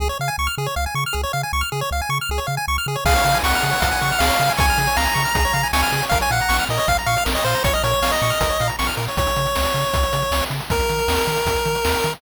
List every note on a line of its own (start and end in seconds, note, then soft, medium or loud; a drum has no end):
0.00 0.10 C#2 loud
0.00 0.08 G#4 medium
0.09 0.18 C#5 medium
0.20 0.30 C#3 medium
0.20 0.29 F5 medium
0.28 0.36 G#5 medium
0.38 0.48 C#2 medium
0.38 0.47 C#6 medium
0.47 0.55 F6 medium
0.58 0.68 C#3 medium
0.58 0.67 G#4 medium
0.66 0.75 C#5 medium
0.76 0.87 C#2 medium
0.76 0.85 F5 medium
0.86 0.95 G#5 medium
0.95 1.05 C#3 medium
0.95 1.04 C#6 medium
1.06 1.15 F6 medium
1.13 1.25 C#2 medium
1.13 1.21 G#4 medium
1.23 1.32 C#5 medium
1.33 1.44 C#3 medium
1.33 1.42 F5 medium
1.43 1.52 G#5 medium
1.53 1.63 C#2 medium
1.53 1.62 C#6 medium
1.61 1.70 F6 medium
1.72 1.83 C#3 medium
1.72 1.81 G#4 medium
1.81 1.90 C#5 medium
1.91 2.01 C#2 medium
1.91 2.01 F5 medium
2.02 2.10 G#5 medium
2.09 2.20 C#3 medium
2.09 2.18 C#6 medium
2.21 2.30 F6 medium
2.29 2.40 C#2 medium
2.29 2.40 G#4 medium
2.38 2.47 C#5 medium
2.47 2.58 C#3 medium
2.47 2.55 F5 medium
2.57 2.66 G#5 medium
2.68 2.78 C#2 medium
2.68 2.77 C#6 medium
2.78 2.87 F6 medium
2.86 2.97 C#3 medium
2.86 2.96 G#4 medium
2.96 3.04 C#5 medium
3.05 3.15 C#2 medium
3.05 3.14 G#4 medium
3.05 3.38 F5 medium
3.05 kick medium
3.05 crash loud
3.15 3.24 C#5 medium
3.15 closed hi-hat medium
3.25 3.35 C#3 medium
3.25 3.34 F5 medium
3.25 closed hi-hat medium
3.34 3.43 G#5 medium
3.34 closed hi-hat medium
3.43 3.54 C#2 medium
3.43 4.20 F#5 medium
3.43 3.52 C#6 medium
3.43 snare loud
3.53 3.64 F6 medium
3.53 closed hi-hat medium
3.62 3.74 C#3 medium
3.62 3.71 G#4 medium
3.62 closed hi-hat medium
3.71 3.80 C#5 medium
3.71 closed hi-hat medium
3.80 3.92 C#2 medium
3.80 3.89 F5 medium
3.80 kick medium
3.80 closed hi-hat loud
3.92 4.00 G#5 medium
3.92 closed hi-hat medium
4.01 4.12 C#3 medium
4.01 4.11 C#6 medium
4.01 closed hi-hat medium
4.11 4.21 F6 medium
4.11 closed hi-hat medium
4.19 4.31 C#2 medium
4.19 4.29 G#4 medium
4.19 4.53 F5 medium
4.19 snare loud
4.29 4.37 C#5 medium
4.29 closed hi-hat medium
4.40 4.50 C#3 medium
4.40 4.50 F5 medium
4.40 closed hi-hat medium
4.49 4.58 G#5 medium
4.49 closed hi-hat medium
4.57 4.70 C#2 medium
4.57 4.97 G#5 medium
4.57 4.66 C#6 medium
4.57 kick loud
4.57 closed hi-hat loud
4.68 4.78 F6 medium
4.68 closed hi-hat medium
4.78 4.88 C#3 medium
4.78 4.87 G#4 medium
4.78 closed hi-hat medium
4.87 4.96 C#5 medium
4.87 closed hi-hat medium
4.96 5.07 C#2 medium
4.96 5.05 F5 medium
4.96 5.68 A#5 medium
4.96 snare medium
5.05 5.14 G#5 medium
5.05 closed hi-hat medium
5.14 5.26 C#3 medium
5.14 5.23 C#6 medium
5.14 closed hi-hat medium
5.25 5.34 F6 medium
5.25 closed hi-hat medium
5.35 5.46 C#2 medium
5.35 5.44 G#4 medium
5.35 kick medium
5.35 closed hi-hat medium
5.45 5.53 C#5 medium
5.45 closed hi-hat medium
5.53 5.64 C#3 medium
5.53 5.62 F5 medium
5.53 closed hi-hat medium
5.63 5.72 G#5 medium
5.63 closed hi-hat medium
5.73 5.84 C#2 medium
5.73 6.05 G#5 medium
5.73 5.82 C#6 medium
5.73 snare loud
5.83 5.91 F6 medium
5.83 closed hi-hat medium
5.92 6.03 C#3 medium
5.92 6.01 G#4 medium
5.92 closed hi-hat medium
6.02 6.11 C#5 medium
6.02 closed hi-hat medium
6.09 6.22 A#1 medium
6.09 6.21 A#4 medium
6.09 6.19 F5 medium
6.09 kick medium
6.09 closed hi-hat medium
6.21 6.30 C#5 medium
6.21 6.31 G#5 medium
6.21 closed hi-hat medium
6.30 6.41 A#2 medium
6.30 6.40 F5 medium
6.30 6.65 F#5 medium
6.30 closed hi-hat medium
6.40 6.50 A#5 medium
6.40 closed hi-hat medium
6.49 6.60 A#1 medium
6.49 6.57 C#6 medium
6.49 snare medium
6.59 6.68 F6 medium
6.59 closed hi-hat medium
6.69 6.79 A#2 medium
6.69 6.79 A#4 medium
6.69 6.79 D#5 medium
6.69 closed hi-hat medium
6.78 6.86 C#5 medium
6.78 6.88 D#5 medium
6.78 closed hi-hat medium
6.88 6.99 A#1 medium
6.88 6.97 F5 medium
6.88 kick medium
6.88 closed hi-hat medium
6.97 7.07 A#5 medium
6.97 closed hi-hat medium
7.06 7.17 A#2 medium
7.06 7.24 F5 medium
7.06 7.15 C#6 medium
7.06 closed hi-hat medium
7.17 7.26 F6 medium
7.17 closed hi-hat medium
7.25 7.37 A#1 loud
7.25 7.34 A#4 medium
7.25 snare loud
7.35 7.43 C#5 medium
7.35 7.44 D#5 medium
7.35 closed hi-hat medium
7.44 7.55 A#2 medium
7.44 7.63 C5 medium
7.44 7.55 F5 medium
7.44 closed hi-hat medium
7.55 7.63 A#5 medium
7.55 closed hi-hat medium
7.64 7.75 A#1 medium
7.64 7.74 C#5 medium
7.64 7.72 C#6 medium
7.64 kick loud
7.64 closed hi-hat loud
7.74 7.83 D#5 medium
7.74 7.84 F6 medium
7.74 closed hi-hat medium
7.83 7.94 A#2 medium
7.83 7.92 A#4 medium
7.83 8.12 C#5 medium
7.83 closed hi-hat medium
7.91 8.00 C#5 medium
7.91 closed hi-hat medium
8.02 8.12 A#1 medium
8.02 8.11 F5 medium
8.02 snare loud
8.12 8.68 D#5 medium
8.12 8.21 A#5 medium
8.12 closed hi-hat medium
8.22 8.32 A#2 medium
8.22 8.31 C#6 medium
8.22 closed hi-hat medium
8.30 8.39 F6 medium
8.30 closed hi-hat medium
8.41 8.51 A#1 medium
8.41 8.49 A#4 medium
8.41 kick medium
8.41 closed hi-hat loud
8.50 8.58 C#5 medium
8.50 closed hi-hat medium
8.60 8.71 A#2 medium
8.60 8.69 F5 medium
8.60 closed hi-hat medium
8.68 8.76 A#5 medium
8.68 closed hi-hat medium
8.79 8.90 A#1 medium
8.79 8.87 C#6 medium
8.79 snare loud
8.87 8.95 F6 medium
8.87 closed hi-hat medium
8.97 9.08 A#2 medium
8.97 9.06 A#4 medium
8.97 closed hi-hat medium
9.08 9.17 C#5 medium
9.08 closed hi-hat medium
9.17 9.28 C#2 medium
9.17 10.44 C#5 medium
9.17 kick medium
9.17 closed hi-hat medium
9.27 closed hi-hat medium
9.36 9.47 C#3 medium
9.36 closed hi-hat medium
9.46 closed hi-hat medium
9.55 9.67 C#2 medium
9.55 snare loud
9.65 closed hi-hat medium
9.74 9.85 C#3 medium
9.74 closed hi-hat medium
9.84 closed hi-hat medium
9.94 10.05 C#2 medium
9.94 kick medium
9.94 closed hi-hat medium
10.03 closed hi-hat medium
10.13 10.24 C#3 medium
10.13 closed hi-hat medium
10.22 closed hi-hat medium
10.31 10.42 C#2 medium
10.31 snare loud
10.41 closed hi-hat medium
10.50 10.61 C#3 medium
10.50 closed hi-hat medium
10.61 closed hi-hat medium
10.70 10.81 D#2 loud
10.70 12.13 A#4 medium
10.70 kick medium
10.70 closed hi-hat medium
10.80 closed hi-hat medium
10.89 11.00 D#3 medium
10.89 closed hi-hat medium
10.99 closed hi-hat medium
11.08 11.19 D#2 medium
11.08 snare loud
11.18 closed hi-hat medium
11.27 11.38 D#3 medium
11.27 closed hi-hat medium
11.37 closed hi-hat medium
11.46 11.56 D#2 medium
11.46 kick medium
11.46 closed hi-hat medium
11.56 closed hi-hat medium
11.66 11.76 D#3 medium
11.66 closed hi-hat medium
11.75 closed hi-hat medium
11.85 11.95 D#2 medium
11.85 snare loud
11.94 closed hi-hat medium
12.04 12.15 D#3 medium
12.04 closed hi-hat medium
12.13 closed hi-hat medium